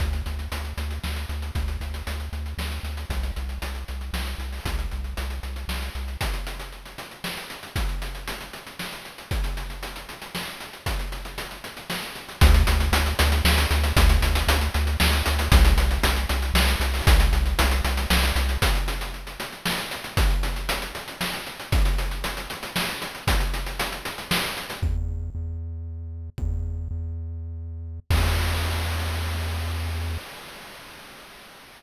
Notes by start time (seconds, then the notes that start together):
0.00 D2, kick, closed hi-hat
0.13 closed hi-hat
0.26 D2, closed hi-hat
0.39 closed hi-hat
0.52 D2, closed hi-hat
0.65 closed hi-hat
0.77 D2, closed hi-hat
0.91 closed hi-hat
1.04 D2, snare
1.16 closed hi-hat
1.29 D2, closed hi-hat
1.42 closed hi-hat
1.55 D2, kick, closed hi-hat
1.68 closed hi-hat
1.81 D2, closed hi-hat
1.94 closed hi-hat
2.07 D2, closed hi-hat
2.20 closed hi-hat
2.33 D2, closed hi-hat
2.46 closed hi-hat
2.58 D2, snare
2.72 closed hi-hat
2.83 D2, closed hi-hat
2.97 closed hi-hat
3.10 C2, kick, closed hi-hat
3.23 closed hi-hat
3.36 C2, closed hi-hat
3.49 closed hi-hat
3.62 C2, closed hi-hat
3.75 closed hi-hat
3.88 C2, closed hi-hat
4.01 closed hi-hat
4.13 C2, snare
4.27 closed hi-hat
4.38 C2, closed hi-hat
4.52 open hi-hat
4.65 C2, kick, closed hi-hat
4.79 closed hi-hat
4.91 C2, closed hi-hat
5.04 closed hi-hat
5.17 C2, closed hi-hat
5.30 closed hi-hat
5.43 C2, closed hi-hat
5.56 closed hi-hat
5.68 C2, snare
5.82 closed hi-hat
5.95 C2, closed hi-hat
6.08 closed hi-hat
6.21 kick, closed hi-hat
6.34 closed hi-hat
6.47 closed hi-hat
6.60 closed hi-hat
6.72 closed hi-hat
6.85 closed hi-hat
6.98 closed hi-hat
7.11 closed hi-hat
7.24 snare
7.37 closed hi-hat
7.50 closed hi-hat
7.63 closed hi-hat
7.76 kick, closed hi-hat
7.89 closed hi-hat
8.02 closed hi-hat
8.15 closed hi-hat
8.28 closed hi-hat
8.41 closed hi-hat
8.53 closed hi-hat
8.66 closed hi-hat
8.79 snare
8.92 closed hi-hat
9.05 closed hi-hat
9.18 closed hi-hat
9.31 kick, closed hi-hat
9.44 closed hi-hat
9.57 closed hi-hat
9.70 closed hi-hat
9.83 closed hi-hat
9.96 closed hi-hat
10.09 closed hi-hat
10.22 closed hi-hat
10.35 snare
10.48 closed hi-hat
10.60 closed hi-hat
10.73 closed hi-hat
10.86 kick, closed hi-hat
10.99 closed hi-hat
11.12 closed hi-hat
11.25 closed hi-hat
11.38 closed hi-hat
11.51 closed hi-hat
11.64 closed hi-hat
11.77 closed hi-hat
11.90 snare
12.03 closed hi-hat
12.15 closed hi-hat
12.29 closed hi-hat
12.41 D2, kick, closed hi-hat
12.54 closed hi-hat
12.67 D2, closed hi-hat
12.80 closed hi-hat
12.92 D2, closed hi-hat
13.06 closed hi-hat
13.19 D2, closed hi-hat
13.32 closed hi-hat
13.45 D2, snare
13.58 closed hi-hat
13.71 D2, closed hi-hat
13.84 closed hi-hat
13.97 D2, kick, closed hi-hat
14.09 closed hi-hat
14.22 D2, closed hi-hat
14.35 closed hi-hat
14.48 D2, closed hi-hat
14.61 closed hi-hat
14.74 D2, closed hi-hat
14.87 closed hi-hat
15.00 D2, snare
15.13 closed hi-hat
15.26 D2, closed hi-hat
15.39 closed hi-hat
15.52 C2, kick, closed hi-hat
15.65 closed hi-hat
15.77 C2, closed hi-hat
15.91 closed hi-hat
16.03 C2, closed hi-hat
16.16 closed hi-hat
16.29 C2, closed hi-hat
16.42 closed hi-hat
16.54 C2, snare
16.68 closed hi-hat
16.80 C2, closed hi-hat
16.94 open hi-hat
17.07 C2, kick, closed hi-hat
17.20 closed hi-hat
17.33 C2, closed hi-hat
17.46 closed hi-hat
17.59 C2, closed hi-hat
17.71 closed hi-hat
17.84 C2, closed hi-hat
17.97 closed hi-hat
18.10 C2, snare
18.23 closed hi-hat
18.36 C2, closed hi-hat
18.49 closed hi-hat
18.62 kick, closed hi-hat
18.75 closed hi-hat
18.88 closed hi-hat
19.01 closed hi-hat
19.14 closed hi-hat
19.27 closed hi-hat
19.40 closed hi-hat
19.52 closed hi-hat
19.66 snare
19.78 closed hi-hat
19.91 closed hi-hat
20.04 closed hi-hat
20.17 kick, closed hi-hat
20.30 closed hi-hat
20.43 closed hi-hat
20.56 closed hi-hat
20.69 closed hi-hat
20.82 closed hi-hat
20.95 closed hi-hat
21.08 closed hi-hat
21.21 snare
21.34 closed hi-hat
21.47 closed hi-hat
21.60 closed hi-hat
21.72 kick, closed hi-hat
21.85 closed hi-hat
21.98 closed hi-hat
22.11 closed hi-hat
22.24 closed hi-hat
22.37 closed hi-hat
22.50 closed hi-hat
22.63 closed hi-hat
22.76 snare
22.89 closed hi-hat
23.02 closed hi-hat
23.15 closed hi-hat
23.27 kick, closed hi-hat
23.40 closed hi-hat
23.54 closed hi-hat
23.66 closed hi-hat
23.80 closed hi-hat
23.92 closed hi-hat
24.05 closed hi-hat
24.18 closed hi-hat
24.31 snare
24.44 closed hi-hat
24.57 closed hi-hat
24.70 closed hi-hat
24.82 E2, kick
25.35 E2
26.38 E2, kick
26.91 E2
28.10 E2, kick, crash